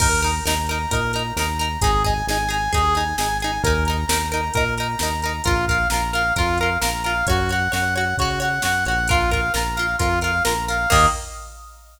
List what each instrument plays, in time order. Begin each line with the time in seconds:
0.00 synth bass 1 D#2, acoustic guitar (steel) D#4 A#4, brass section A#4, kick, crash
0.22 acoustic guitar (steel) D#4 A#4, brass section A#5, closed hi-hat
0.45 synth bass 1 D#2, acoustic guitar (steel) D#4 A#4, brass section A#5, snare
0.67 acoustic guitar (steel) A#4, brass section A#5, closed hi-hat
0.71 acoustic guitar (steel) D#4
0.91 synth bass 1 A#2, acoustic guitar (steel) D#4 A#4, brass section A#4, kick, closed hi-hat
1.13 acoustic guitar (steel) D#4 A#4, brass section A#5, closed hi-hat
1.36 synth bass 1 D#2, acoustic guitar (steel) D#4 A#4, brass section A#5, snare
1.59 acoustic guitar (steel) D#4 A#4, brass section A#5, closed hi-hat
1.81 synth bass 1 G#1, acoustic guitar (steel) D#4 G#4, brass section G#4, kick, closed hi-hat
2.04 acoustic guitar (steel) D#4 G#4, brass section G#5, kick, closed hi-hat
2.27 synth bass 1 G#1, acoustic guitar (steel) D#4 G#4, brass section G#5, snare
2.49 acoustic guitar (steel) D#4 G#4, brass section G#5, closed hi-hat
2.73 synth bass 1 D#2, acoustic guitar (steel) D#4 G#4, brass section G#4, kick, closed hi-hat
2.95 acoustic guitar (steel) D#4 G#4, brass section G#5, closed hi-hat
3.17 synth bass 1 G#1, acoustic guitar (steel) D#4 G#4, brass section G#5, snare
3.40 acoustic guitar (steel) D#4 G#4, brass section G#5, closed hi-hat
3.63 synth bass 1 D#2, acoustic guitar (steel) D#4 A#4, brass section A#4, kick, closed hi-hat
3.85 acoustic guitar (steel) A#4, brass section A#5, closed hi-hat
3.90 acoustic guitar (steel) D#4
4.07 synth bass 1 D#2, acoustic guitar (steel) A#4, brass section A#5, snare
4.11 acoustic guitar (steel) D#4
4.32 acoustic guitar (steel) D#4 A#4, brass section A#5, closed hi-hat
4.54 synth bass 1 A#2, acoustic guitar (steel) D#4 A#4, brass section A#4, kick, closed hi-hat
4.77 acoustic guitar (steel) D#4 A#4, brass section A#5, closed hi-hat
4.99 synth bass 1 D#2, acoustic guitar (steel) D#4 A#4, brass section A#5, snare
5.21 acoustic guitar (steel) A#4, brass section A#5, closed hi-hat
5.25 acoustic guitar (steel) D#4
5.44 synth bass 1 A#1, brass section F4, acoustic guitar (steel) F4 A#4, kick, closed hi-hat
5.67 acoustic guitar (steel) F4 A#4, brass section F5, kick, closed hi-hat
5.90 synth bass 1 A#1, acoustic guitar (steel) F4 A#4, brass section A#5, snare
6.13 acoustic guitar (steel) F4 A#4, brass section F5, closed hi-hat
6.36 synth bass 1 F2, brass section F4, acoustic guitar (steel) F4 A#4, kick, closed hi-hat
6.58 acoustic guitar (steel) A#4, brass section F5, closed hi-hat
6.63 acoustic guitar (steel) F4
6.82 synth bass 1 A#1, acoustic guitar (steel) F4 A#4, brass section A#5, snare
7.04 acoustic guitar (steel) F4 A#4, brass section F5, closed hi-hat
7.27 synth bass 1 F#2, acoustic guitar (steel) F#4 C#5, brass section F#4, kick, closed hi-hat
7.49 acoustic guitar (steel) F#4 C#5, brass section F#5, closed hi-hat
7.72 synth bass 1 F#2, acoustic guitar (steel) F#4 C#5, brass section F#5, snare
7.95 acoustic guitar (steel) F#4 C#5, brass section F#5, closed hi-hat
8.18 synth bass 1 C#3, brass section F#4, acoustic guitar (steel) F#4 C#5, kick, closed hi-hat
8.40 acoustic guitar (steel) F#4 C#5, brass section F#5, closed hi-hat
8.62 synth bass 1 F#2, acoustic guitar (steel) F#4 C#5, brass section F#5, snare
8.85 synth bass 1 A#1, acoustic guitar (steel) F#4 C#5, brass section F#5, closed hi-hat
9.07 brass section F4, acoustic guitar (steel) F4 A#4, kick, closed hi-hat
9.31 acoustic guitar (steel) F4 A#4, brass section F5, kick, closed hi-hat
9.54 synth bass 1 A#1, acoustic guitar (steel) F4 A#4, brass section A#5, snare
9.75 acoustic guitar (steel) F4 A#4, brass section F5, closed hi-hat
9.98 synth bass 1 F2, brass section F4, acoustic guitar (steel) F4 A#4, kick, closed hi-hat
10.21 acoustic guitar (steel) F4 A#4, brass section F5, closed hi-hat
10.44 synth bass 1 A#1, acoustic guitar (steel) F4 A#4, brass section A#5, snare
10.68 acoustic guitar (steel) F4 A#4, brass section F5, closed hi-hat
10.90 synth bass 1 D#2, acoustic guitar (steel) D#3 A#3, brass section D#5, kick, crash